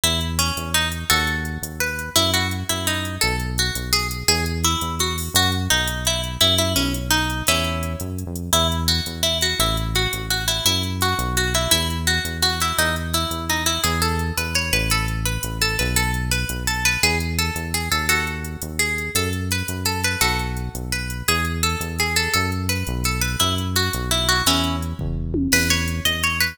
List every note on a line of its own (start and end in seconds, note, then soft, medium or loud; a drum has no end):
0.03 0.51 E2 medium
0.03 0.20 E4 medium
0.03 closed hi-hat medium
0.21 closed hi-hat medium
0.39 0.71 C#4 medium
0.39 closed hi-hat medium
0.57 1.05 E2 medium
0.57 closed hi-hat medium
0.74 0.89 D#4 medium
0.74 closed hi-hat medium
0.92 closed hi-hat medium
1.10 1.58 D#2 medium
1.10 1.76 F#4 medium
1.10 1.76 A4 medium
1.10 closed hi-hat medium
1.27 closed hi-hat medium
1.45 closed hi-hat medium
1.62 2.10 D#2 soft
1.62 closed hi-hat medium
1.80 2.10 B4 medium
1.80 closed hi-hat medium
1.99 closed hi-hat medium
2.16 2.64 F#2 medium
2.16 2.31 E4 loud
2.16 closed hi-hat medium
2.34 2.48 F#4 medium
2.34 closed hi-hat medium
2.51 closed hi-hat medium
2.69 3.18 F#2 medium
2.69 2.86 E4 medium
2.69 closed hi-hat medium
2.87 3.16 D#4 medium
2.87 closed hi-hat medium
3.05 closed hi-hat medium
3.21 3.71 B1 medium
3.21 3.36 A4 medium
3.21 closed hi-hat medium
3.40 closed hi-hat medium
3.58 3.89 F#4 medium
3.58 closed hi-hat medium
3.75 4.23 B1 medium
3.75 closed hi-hat medium
3.93 4.08 G#4 loud
3.93 closed hi-hat medium
4.11 closed hi-hat medium
4.28 4.76 E2 medium
4.28 4.45 G#4 loud
4.28 closed hi-hat medium
4.46 closed hi-hat medium
4.64 4.95 E4 medium
4.64 closed hi-hat medium
4.81 5.29 E2 medium
4.81 closed hi-hat medium
4.99 5.16 F#4 medium
4.99 closed hi-hat medium
5.18 open hi-hat medium
5.34 5.68 F#2 medium
5.34 5.51 F#4 loud
5.34 closed hi-hat medium
5.52 closed hi-hat medium
5.70 6.38 B1 medium
5.70 6.04 D#4 medium
5.70 closed hi-hat medium
5.88 closed hi-hat medium
6.05 6.21 E4 medium
6.05 closed hi-hat medium
6.24 closed hi-hat medium
6.41 6.75 F#2 medium
6.41 6.55 E4 loud
6.41 closed hi-hat medium
6.58 6.73 E4 medium
6.58 closed hi-hat medium
6.76 7.43 B1 medium
6.76 6.92 C#4 medium
6.76 closed hi-hat medium
6.94 closed hi-hat medium
7.11 7.43 D#4 medium
7.11 closed hi-hat medium
7.30 closed hi-hat medium
7.47 7.96 E2 medium
7.47 7.93 C#4 medium
7.47 7.93 E4 medium
7.47 closed hi-hat medium
7.64 closed hi-hat medium
7.83 closed hi-hat medium
8.00 8.24 F#2 medium
8.00 closed hi-hat medium
8.18 closed hi-hat medium
8.26 8.50 F2 medium
8.36 closed hi-hat medium
8.53 9.01 E2 medium
8.53 8.67 E4 loud
8.53 closed hi-hat medium
8.72 closed hi-hat medium
8.88 9.23 F#4 medium
8.88 closed hi-hat medium
9.06 9.54 E2 medium
9.06 closed hi-hat medium
9.23 9.38 E4 medium
9.23 closed hi-hat medium
9.41 9.59 F#4 medium
9.41 closed hi-hat medium
9.59 10.07 A1 medium
9.59 9.77 E4 medium
9.59 closed hi-hat medium
9.77 closed hi-hat medium
9.95 10.26 F#4 medium
9.95 closed hi-hat medium
10.13 10.61 A1 medium
10.13 closed hi-hat medium
10.30 10.46 F#4 medium
10.30 closed hi-hat medium
10.48 10.64 E4 medium
10.48 closed hi-hat medium
10.65 11.14 F#2 medium
10.65 10.83 E4 medium
10.65 closed hi-hat medium
10.83 closed hi-hat medium
11.01 11.36 F#4 medium
11.01 closed hi-hat medium
11.19 11.67 B1 medium
11.19 closed hi-hat medium
11.37 11.53 F#4 medium
11.37 closed hi-hat medium
11.54 11.71 E4 medium
11.54 closed hi-hat medium
11.71 12.20 E2 medium
11.71 11.88 E4 loud
11.71 closed hi-hat medium
11.90 closed hi-hat medium
12.07 12.38 F#4 medium
12.07 closed hi-hat medium
12.25 12.73 E2 medium
12.25 closed hi-hat medium
12.42 12.60 F#4 medium
12.42 closed hi-hat medium
12.60 12.77 E4 medium
12.60 closed hi-hat medium
12.78 13.26 E2 medium
12.78 12.95 D#4 medium
12.78 closed hi-hat medium
12.96 closed hi-hat medium
13.14 13.45 E4 medium
13.14 closed hi-hat medium
13.31 13.78 E2 soft
13.31 closed hi-hat medium
13.49 13.64 D#4 medium
13.49 closed hi-hat soft
13.66 13.81 E4 medium
13.66 closed hi-hat medium
13.84 14.32 E2 medium
13.84 14.01 G#4 medium
13.84 closed hi-hat medium
14.02 14.33 A4 medium
14.02 closed hi-hat medium
14.19 closed hi-hat medium
14.37 14.71 E2 medium
14.37 14.55 B4 medium
14.37 closed hi-hat medium
14.55 14.72 C#5 medium
14.55 closed hi-hat medium
14.73 15.38 A1 medium
14.73 14.90 B4 medium
14.73 closed hi-hat medium
14.90 15.06 A4 medium
14.90 closed hi-hat medium
15.08 closed hi-hat medium
15.25 15.58 B4 medium
15.25 closed hi-hat medium
15.43 15.77 A1 medium
15.43 closed hi-hat medium
15.61 15.76 A4 medium
15.61 closed hi-hat medium
15.79 16.45 B1 medium
15.79 15.96 B4 medium
15.79 closed hi-hat medium
15.96 16.11 A4 loud
15.96 closed hi-hat medium
16.14 closed hi-hat medium
16.31 16.63 B4 medium
16.31 closed hi-hat medium
16.49 16.97 B1 medium
16.49 closed hi-hat medium
16.67 16.84 A4 medium
16.67 closed hi-hat medium
16.85 17.02 B4 medium
16.85 closed hi-hat medium
17.03 17.51 E2 medium
17.03 17.18 G#4 medium
17.03 closed hi-hat medium
17.20 closed hi-hat medium
17.39 17.70 A4 medium
17.39 closed hi-hat medium
17.56 17.89 E2 medium
17.56 closed hi-hat medium
17.74 17.89 G#4 medium
17.74 closed hi-hat soft
17.91 18.57 D#2 medium
17.91 18.06 A4 medium
17.91 closed hi-hat medium
18.09 18.68 F#4 medium
18.09 18.68 A4 medium
18.09 closed hi-hat medium
18.27 closed hi-hat medium
18.44 closed hi-hat medium
18.62 19.10 D#2 medium
18.62 closed hi-hat medium
18.79 19.11 G#4 medium
18.79 closed hi-hat medium
18.98 closed hi-hat medium
19.15 19.63 F#2 medium
19.15 19.30 A4 loud
19.15 closed hi-hat medium
19.33 closed hi-hat medium
19.51 19.84 B4 medium
19.51 closed hi-hat medium
19.68 20.16 F#2 medium
19.68 closed hi-hat medium
19.85 20.01 A4 medium
19.85 closed hi-hat medium
20.04 20.21 B4 medium
20.04 closed hi-hat medium
20.21 20.69 B1 medium
20.21 20.83 F#4 medium
20.21 20.83 A4 medium
20.21 closed hi-hat medium
20.39 closed hi-hat soft
20.57 closed hi-hat medium
20.75 21.23 B1 medium
20.75 closed hi-hat medium
20.92 21.26 B4 medium
20.92 closed hi-hat medium
21.10 closed hi-hat medium
21.28 21.76 E2 medium
21.28 21.45 G#4 loud
21.28 closed hi-hat medium
21.45 closed hi-hat medium
21.63 21.96 A4 medium
21.63 closed hi-hat medium
21.80 22.28 E2 medium
21.80 closed hi-hat medium
21.99 22.16 G#4 medium
21.99 closed hi-hat medium
22.16 22.32 A4 medium
22.16 closed hi-hat medium
22.34 22.84 F#2 medium
22.34 22.50 A4 medium
22.34 closed hi-hat medium
22.52 closed hi-hat soft
22.69 23.03 B4 medium
22.69 closed hi-hat medium
22.87 23.36 B1 medium
22.87 closed hi-hat medium
23.04 23.22 A4 medium
23.04 closed hi-hat medium
23.21 23.37 B4 medium
23.21 closed hi-hat medium
23.40 23.90 F#2 medium
23.40 23.55 E4 medium
23.40 closed hi-hat medium
23.58 closed hi-hat medium
23.76 24.10 F#4 medium
23.76 closed hi-hat medium
23.93 24.43 B1 medium
23.93 closed hi-hat medium
24.11 24.28 E4 medium
24.11 closed hi-hat medium
24.29 24.44 F#4 medium
24.29 closed hi-hat medium
24.46 24.94 E2 medium
24.46 24.76 C#4 medium
24.46 24.76 E4 medium
24.46 closed hi-hat medium
24.64 closed hi-hat medium
24.82 closed hi-hat medium
24.99 25.48 E2 medium
24.99 kick medium
24.99 floor tom medium
25.34 high tom medium
25.52 26.00 E2 medium
25.52 25.69 B4 loud
25.52 crash medium
25.70 25.99 C#5 medium
25.70 closed hi-hat medium
25.88 closed hi-hat medium
26.05 26.53 E2 medium
26.05 26.22 D#5 medium
26.05 closed hi-hat medium
26.23 26.39 C#5 medium
26.23 closed hi-hat medium
26.40 26.57 B4 loud
26.40 closed hi-hat medium